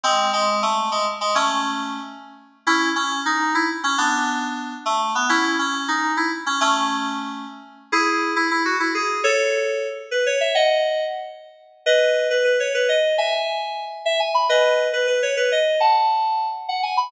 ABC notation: X:1
M:9/8
L:1/8
Q:3/8=137
K:C#m
V:1 name="Electric Piano 2"
[G,^B,]2 G,2 A,2 G, z G, | [A,C]5 z4 | [CE]2 C2 D2 E z C | [B,=D]6 A,2 B, |
[CE]2 C2 D2 E z C | [A,C]6 z3 | [K:E] [EG]3 E E F E G2 | [Ac]5 z B c e |
[df]4 z5 | [Bd]3 B B c B d2 | [eg]5 z e g b | [Bd]3 B B c B d2 |
[fa]5 z f g b |]